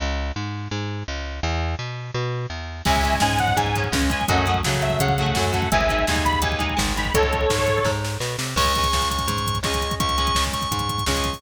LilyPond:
<<
  \new Staff \with { instrumentName = "Lead 2 (sawtooth)" } { \time 4/4 \key cis \minor \tempo 4 = 168 r1 | r1 | <e'' gis''>4 gis''8 fis''8 gis''4 r8 gis''8 | <dis'' fis''>4 r8 e''8 fis''4. fis''8 |
<e'' gis''>4 gis''8 b''8 gis''4 r8 b''8 | <a' cis''>2~ <a' cis''>8 r4. | r1 | r1 | }
  \new Staff \with { instrumentName = "Drawbar Organ" } { \time 4/4 \key cis \minor r1 | r1 | r1 | r1 |
r1 | r1 | cis'''4. cis'''4. cis'''4 | cis'''4. cis'''4. cis'''4 | }
  \new Staff \with { instrumentName = "Overdriven Guitar" } { \time 4/4 \key cis \minor r1 | r1 | <gis cis'>8 <gis cis'>8 <gis cis'>4. <gis cis'>8 <gis cis'>8 <gis cis'>8 | <fis a cis'>8 <fis a cis'>8 <fis a cis'>4. <fis a cis'>8 <fis a cis'>8 <fis a cis'>8 |
<gis dis'>8 <gis dis'>8 <gis dis'>4. <gis dis'>8 <gis dis'>8 <gis dis'>8 | r1 | <gis cis'>8 <gis cis'>2~ <gis cis'>8 <gis cis'>4~ | <gis cis'>8 <gis cis'>2~ <gis cis'>8 <gis cis'>4 | }
  \new Staff \with { instrumentName = "Electric Bass (finger)" } { \clef bass \time 4/4 \key cis \minor cis,4 gis,4 gis,4 cis,4 | e,4 b,4 b,4 e,4 | cis,4 gis,4 gis,4 cis,4 | fis,4 cis4 cis4 fis,4 |
gis,,4 dis,4 dis,4 gis,,4 | cis,4 gis,4 gis,4 b,8 bis,8 | cis,4 cis,4 gis,4 cis,4 | cis,4 cis,4 gis,4 cis,4 | }
  \new DrumStaff \with { instrumentName = "Drums" } \drummode { \time 4/4 r4 r4 r4 r4 | r4 r4 r4 r4 | <cymc bd>16 bd16 <hh bd>16 bd16 <bd sn>16 bd16 <hh bd>16 bd16 <hh bd>16 bd16 <hh bd>16 bd16 <bd sn>16 bd16 <hh bd>16 bd16 | <hh bd>16 bd16 <hh bd>16 bd16 <bd sn>16 bd16 <hh bd>16 bd16 <hh bd>16 bd16 <hh bd>16 bd16 <bd sn>16 bd16 <hh bd>16 bd16 |
<hh bd>16 bd16 <hh bd>16 bd16 <bd sn>16 bd16 <hh bd>16 bd16 <hh bd>16 bd16 <hh bd>16 bd16 <bd sn>16 bd16 <hh bd>16 bd16 | <hh bd>16 bd16 <hh bd>16 bd16 <bd sn>16 bd16 <hh bd>16 bd16 <bd sn>8 sn8 sn8 sn8 | <cymc bd>16 <hh bd>16 <hh bd>16 <hh bd>16 <bd sn>16 <hh bd>16 <hh bd>16 <hh bd>16 <hh bd>16 <hh bd>16 <hh bd>16 <hh bd>16 <bd sn>16 <hh bd>16 <hh bd>16 <hh bd>16 | <hh bd>16 <hh bd>16 <hh bd>16 <hh bd>16 <bd sn>16 <hh bd>16 <hh bd>16 <hh bd>16 <hh bd>16 <hh bd>16 <hh bd>16 <hh bd>16 <bd sn>16 <hh bd>16 <hh bd>16 <hho bd>16 | }
>>